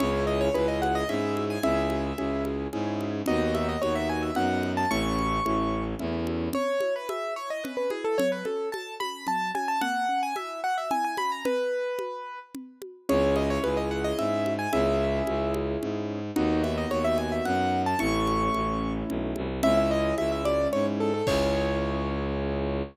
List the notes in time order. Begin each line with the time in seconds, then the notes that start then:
0.00 C#2 C#4 E4 G#4 C#5, low conga
0.27 D#5
0.41 C#5
0.54 C#2 C#4 E4 G#4 B4, high conga
0.68 D#5
0.82 F#5, high conga
0.95 D#5
1.09 G#2 C#4 E4 G#4 E5, low conga
1.37 high conga
1.50 G#5
1.63 C#2 C#4 E4 G#4 E5, low conga
1.90 high conga
2.18 C#2 C#4 E4 G#4, high conga
2.45 high conga
2.73 G#2 C#4 E4 G#4, low conga
3.01 high conga
3.26 D#2 B3 D#4 F#4 D#5, low conga
3.54 E5, high conga
3.69 D#5
3.82 D#2 B3 D#4 F#4 C#5, high conga
3.95 E5
4.09 G#5
4.23 E5
4.35 F#2 B3 D#4 F#4 F#5, low conga
4.63 high conga
4.77 A5
4.91 A1 A3 C#4 E4 C#6, low conga
5.19 high conga
5.45 A1 A3 C#4 E4, high conga
5.99 E2 A3 C#4 E4, low conga
6.27 high conga
6.53 C#4 C#5, low conga
6.80 E4, high conga
6.96 B4
7.09 G#4 E5, high conga
7.36 E4 C#5
7.50 D#5
7.64 C#4 B4, low conga
7.77 B4
7.90 E4 G#4, high conga
8.04 A4
8.18 F#3 C#5, low conga
8.32 B4
8.45 C#4 A4, high conga
8.72 A4 A5, high conga
9.00 C#4 B5, high conga
9.27 F#3 A5, low conga
9.55 C#4 G#5, high conga
9.68 A5
9.81 A#3 F#5, low conga
10.09 C#4
10.23 G#5
10.36 E4 E5, high conga
10.64 F#4 F#5
10.78 E5
10.91 E4 G#5, low conga
11.05 G#5
11.17 C#4 B5, high conga
11.32 A#5
11.45 B4, low conga
11.99 high conga
12.55 low conga
12.82 high conga
13.09 C#2 C#4 E4 G#4 C#5, low conga
13.36 D#5, high conga
13.50 C#5
13.64 C#2 B4, high conga
13.77 D#5
13.91 F#5
14.04 D#5
14.18 G#2 E5, low conga
14.46 high conga
14.59 G#5
14.73 C#2 C#4 E4 G#4 E5, low conga
15.27 C#2, high conga
15.54 high conga
15.82 G#2, low conga
16.36 D#2 B3 D#4 F#4, low conga
16.63 E5, high conga
16.78 D#5
16.91 D#2 C#5, high conga
17.04 E5
17.18 G#5, high conga
17.32 E5
17.45 F#2 F#5, low conga
17.86 A5
17.99 A1 A3 C#4 E4 C#6, low conga
18.27 high conga
18.54 A1, high conga
19.09 B1, low conga
19.36 C2, high conga
19.63 C#2 G#3 C#4 E4 E5, low conga
19.77 E5
19.91 D#5
20.18 C#2 E5, high conga
20.32 E5
20.45 D5, high conga
20.73 G#2 C#5, low conga
21.00 A4
21.14 A4
21.27 C#2 C#4 E4 G#4 C#5, kick, crash